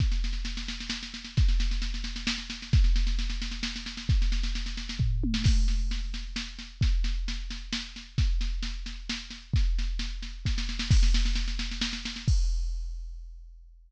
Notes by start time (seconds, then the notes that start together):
0.00 kick, snare
0.12 snare
0.24 snare
0.33 snare
0.45 snare
0.57 snare
0.68 snare
0.80 snare
0.90 snare
1.03 snare
1.14 snare
1.25 snare
1.37 kick, snare
1.48 snare
1.60 snare
1.71 snare
1.82 snare
1.94 snare
2.04 snare
2.16 snare
2.27 snare
2.38 snare
2.50 snare
2.62 snare
2.73 kick, snare
2.84 snare
2.96 snare
3.07 snare
3.19 snare
3.30 snare
3.42 snare
3.51 snare
3.63 snare
3.76 snare
3.86 snare
3.97 snare
4.09 kick, snare
4.22 snare
4.32 snare
4.43 snare
4.55 snare
4.66 snare
4.77 snare
4.89 snare
4.99 kick, floor tom
5.24 high tom
5.34 snare
5.44 kick, snare, crash
5.68 snare
5.91 snare
6.14 snare
6.36 snare
6.59 snare
6.81 kick, snare
7.04 snare
7.28 snare
7.50 snare
7.73 snare
7.96 snare
8.18 kick, snare
8.41 snare
8.63 snare
8.86 snare
9.09 snare
9.30 snare
9.54 kick, snare
9.79 snare
9.99 snare
10.22 snare
10.45 kick, snare
10.58 snare
10.69 snare
10.79 snare
10.91 kick, snare, crash
11.03 snare
11.14 snare
11.25 snare
11.36 snare
11.48 snare
11.59 snare
11.71 snare
11.81 snare
11.93 snare
12.05 snare
12.16 snare
12.28 kick, crash